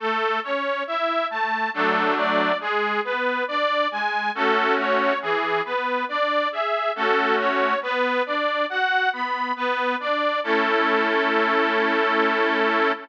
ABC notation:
X:1
M:3/4
L:1/8
Q:1/4=69
K:A
V:1 name="Accordion"
A c e a A d | G B d g A c | G B d e A c | B d f b B d |
A6 |]
V:2 name="Accordion"
A, C E A, [F,A,D]2 | G, B, D G, [A,CF]2 | E, B, D G [A,CF]2 | B, D F B, B, D |
[A,CE]6 |]